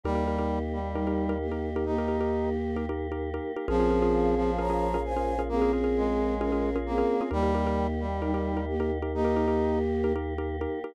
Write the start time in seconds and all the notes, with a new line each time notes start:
0.04 D#2 G3 A#3 D#4 G4 A#4
0.15 D#4 G4 A#4
0.27 D#4 G4 A#4
0.39 D#4 G4 A#4
0.73 G3
0.95 G3 D#4 G4 A#4
1.07 D#4 G4 A#4
1.29 D#4 G4 A#4
1.41 A#3 G4
1.52 D#4 G4 A#4
1.76 D#4 G4 A#4
1.85 A#3 D#4 G4 A#4
1.98 D#4 G4 A#4
2.08 D#4 G4 A#4
2.21 D#4 G4 A#4
2.76 D#4 G4 A#4
2.89 D#4 G4 A#4
3.12 D#4 G4 A#4
3.34 D#4 G4 A#4
3.56 D#4 G4 A#4
3.68 A#1 F3 A#3 C4 C#4 F4 G#4 A#4
3.80 C#4 F4 G#4 A#4
3.90 C#4 F4 G#4 A#4
4.02 C#4 F4 G#4 A#4
4.37 F3
4.59 C#4 F4 G#4 A#4 C#5 A#5
4.70 C#4 F4 G#4 A#4
4.94 C#4 F4 G#4 A#4
5.05 C5 G#5
5.17 C#4 F4 G#4 A#4
5.39 C#4 F4 G#4 A#4
5.49 A#3 C4 C#4 G#4 A#4
5.62 C#4 F4 G#4 A#4
5.73 C#4 F4 G#4 A#4
5.84 C#4 F4 G#4 A#4
5.97 G#3
6.41 C#4 F4 G#4 A#4
6.52 C#4 F4 G#4 A#4
6.76 C#4 F4 G#4 A#4
6.86 A#3 C4 G#4
6.98 C#4 F4 G#4 A#4
7.21 C#4 F4 G#4 A#4
7.31 D#2 G3 A#3 D#4 G4 A#4
7.43 D#4 G4 A#4
7.55 D#4 G4 A#4
7.67 D#4 G4 A#4
8.00 G3
8.22 G3 D#4 G4 A#4
8.34 D#4 G4 A#4
8.57 D#4 G4 A#4
8.68 A#3 G4
8.80 D#4 G4 A#4
9.02 D#4 G4 A#4
9.14 A#3 D#4 G4 A#4
9.25 D#4 G4 A#4
9.36 D#4 G4 A#4
9.48 D#4 G4 A#4
10.04 D#4 G4 A#4
10.16 D#4 G4 A#4
10.38 D#4 G4 A#4
10.61 D#4 G4 A#4
10.84 D#4 G4 A#4